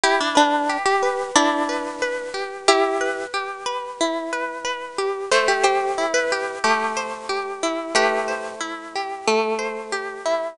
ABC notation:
X:1
M:4/4
L:1/16
Q:1/4=91
K:Em
V:1 name="Orchestral Harp"
G D D3 G3 D8 | [EG]4 z12 | c G G3 B3 G8 | [GB]4 z12 |]
V:2 name="Orchestral Harp"
E2 B2 G2 B2 E2 B2 B2 G2 | z2 B2 G2 B2 E2 B2 B2 G2 | A,2 c2 E2 G2 A,2 c2 G2 E2 | A,2 c2 E2 G2 A,2 c2 G2 E2 |]